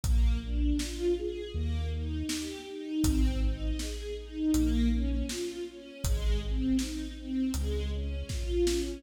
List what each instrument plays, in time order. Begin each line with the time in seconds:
0.03 synth bass 2 A#1, string ensemble 1 A#3, kick, closed hi-hat
0.43 string ensemble 1 D4
0.79 string ensemble 1 F4, snare
1.18 string ensemble 1 G#4
1.53 synth bass 2 D#2, string ensemble 1 A#3
1.92 string ensemble 1 D#4
2.28 string ensemble 1 G4, snare
2.67 string ensemble 1 D#4
3.03 synth bass 2 G#1, string ensemble 1 C4, kick, closed hi-hat
3.41 string ensemble 1 D#4
3.79 string ensemble 1 G#4, snare
4.16 string ensemble 1 D#4
4.54 synth bass 2 A#1, string ensemble 1 A#3, closed hi-hat
4.91 string ensemble 1 C#4
5.29 string ensemble 1 F4, snare
5.68 string ensemble 1 C#4
6.04 synth bass 2 G#1, string ensemble 1 G#3, kick, closed hi-hat
6.42 string ensemble 1 C4
6.79 string ensemble 1 D#4, snare
7.17 string ensemble 1 C4
7.54 synth bass 2 C#2, string ensemble 1 G#3, closed hi-hat
7.92 string ensemble 1 C#4
8.29 string ensemble 1 F4, kick, snare
8.67 string ensemble 1 C#4, snare